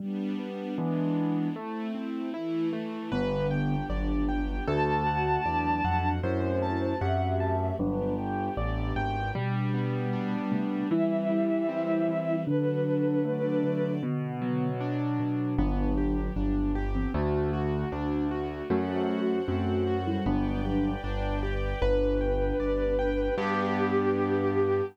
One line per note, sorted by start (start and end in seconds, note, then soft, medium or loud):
0.00 0.35 G3 medium
0.00 0.77 G3 medium
0.00 0.77 B3 medium
0.00 0.77 D4 medium
0.39 0.74 B3 medium
0.78 1.48 E3 medium
0.78 1.55 E3 medium
0.78 1.48 G#3 medium
0.78 1.55 G#3 medium
0.78 1.48 B3 medium
0.78 1.55 B3 medium
0.78 1.48 D4 medium
0.78 1.55 D4 medium
1.56 2.33 A3 medium
1.56 1.91 A3 medium
1.56 2.33 C4 medium
1.56 2.33 E4 medium
1.95 2.30 C4 medium
2.34 3.11 E3 medium
2.34 3.11 A3 medium
2.34 2.69 E4 medium
2.34 3.11 E4 medium
2.73 3.08 A3 medium
3.12 3.82 G1 loud
3.12 3.76 D3 medium
3.12 4.66 B3 medium
3.12 3.76 B3 medium
3.12 4.66 D4 medium
3.12 4.66 G4 medium
3.12 3.47 B4 medium
3.51 3.86 G5 medium
3.90 4.60 G1 medium
3.90 4.56 F#3 medium
3.90 4.56 D4 medium
3.90 4.25 D5 medium
4.29 4.64 G5 medium
4.68 5.38 D2 loud
4.68 6.22 A3 medium
4.68 5.41 A3 medium
4.68 6.22 D4 medium
4.68 6.22 F#4 medium
4.68 5.41 F#4 medium
4.68 5.03 A4 medium
4.68 6.08 A5 medium
5.06 5.42 F#5 medium
5.45 5.81 E2 medium
5.45 6.14 F#3 medium
5.45 6.14 D4 medium
5.45 5.81 D5 medium
5.84 6.19 F2 medium
5.84 6.19 F#5 medium
6.23 6.94 F#2 loud
6.23 7.78 A3 medium
6.23 7.78 C4 medium
6.23 6.96 E4 medium
6.23 7.78 F#4 medium
6.23 6.96 C5 medium
6.23 6.58 C5 medium
6.62 6.97 A5 medium
7.01 7.71 F#2 medium
7.01 7.76 G4 medium
7.01 7.76 E5 medium
7.01 7.36 F#5 medium
7.40 7.75 A5 medium
7.79 8.49 G1 loud
7.79 8.13 F#3 medium
7.79 9.33 B3 medium
7.79 9.33 D4 medium
7.79 8.13 D4 medium
7.79 9.33 G4 medium
7.79 8.14 B4 medium
8.18 8.53 G5 medium
8.57 8.92 A1 medium
8.57 8.92 D5 medium
8.96 9.31 G#1 medium
8.96 9.31 G5 medium
9.35 10.37 B2 medium
9.35 10.51 G3 loud
9.35 10.90 G3 medium
9.35 10.37 G3 medium
9.35 10.90 B3 medium
9.35 10.90 D4 medium
9.74 10.85 B3 medium
10.13 10.87 D4 medium
10.51 10.83 C3 medium
10.51 10.89 G3 medium
10.51 10.83 A3 medium
10.90 12.07 E3 medium
10.90 12.45 E3 medium
10.90 12.36 G3 loud
10.90 12.45 G3 medium
10.90 12.45 C4 medium
10.90 12.36 E4 loud
10.90 12.39 E5 soft
11.30 12.41 G3 medium
11.69 12.43 C4 medium
12.08 12.45 E3 medium
12.46 13.63 D3 medium
12.46 13.94 F#3 medium
12.46 13.24 D4 medium
12.46 13.94 D4 medium
12.46 13.24 F#4 medium
12.46 13.24 A4 medium
12.46 13.91 B4 medium
12.86 13.97 F#3 medium
13.25 13.99 A3 medium
13.25 14.02 D4 medium
13.25 14.02 A4 medium
13.25 14.02 D5 medium
13.64 14.01 D3 medium
14.03 15.19 B2 loud
14.03 14.70 D3 medium
14.03 14.70 B3 medium
14.42 15.53 F#3 medium
14.81 15.55 D4 medium
15.19 15.56 B2 medium
15.58 16.29 G1 loud
15.58 16.30 F#3 medium
15.58 17.13 B3 medium
15.58 15.94 B3 medium
15.58 16.30 D4 loud
15.58 17.13 D4 medium
15.58 17.13 G4 medium
15.97 16.32 G4 medium
16.36 17.06 G1 medium
16.36 16.84 F#3 medium
16.36 16.84 D4 medium
16.36 16.71 D4 medium
16.75 17.10 G4 medium
16.95 17.13 E3 medium
16.95 17.13 C4 medium
17.14 17.84 D2 loud
17.14 17.49 A3 medium
17.14 18.69 A3 medium
17.14 17.51 A3 medium
17.14 18.69 D4 medium
17.14 18.69 F#4 medium
17.14 17.51 F#4 loud
17.53 17.88 F#4 medium
17.92 18.62 D2 medium
17.92 18.27 D4 medium
18.31 18.66 F#4 medium
18.70 19.40 F#2 loud
18.70 19.38 A3 medium
18.70 19.05 A3 medium
18.70 19.38 F#4 medium
18.70 20.25 A4 medium
18.70 20.25 C5 medium
18.70 20.25 F#5 medium
19.09 19.44 F#4 medium
19.48 20.18 F#2 medium
19.48 20.05 A3 medium
19.48 19.83 C4 medium
19.48 20.05 F#4 medium
19.87 20.22 F#4 medium
20.07 20.25 G3 medium
20.07 20.25 E4 medium
20.26 20.96 G1 loud
20.26 20.90 F#3 medium
20.26 20.61 B3 medium
20.26 20.90 D4 loud
20.26 21.80 B4 medium
20.26 21.80 D5 medium
20.26 21.80 G5 medium
20.65 21.00 G4 medium
21.04 21.74 G1 medium
21.04 21.39 D4 medium
21.43 21.78 G4 medium
21.81 22.52 G1 loud
21.81 23.36 B3 medium
21.81 23.29 D4 medium
21.81 23.36 D4 medium
21.81 23.36 G4 medium
21.81 23.29 B4 medium
21.81 23.35 B4 medium
21.81 22.17 B4 medium
22.21 22.56 G5 medium
22.60 23.30 G1 medium
22.60 22.95 D5 medium
22.99 23.34 G5 medium
23.37 24.81 G2 loud
23.37 24.81 B3 loud
23.37 24.81 D4 loud
23.37 24.81 D4 medium
23.37 24.81 G4 loud
23.37 24.81 G4 medium
23.37 24.81 G4 loud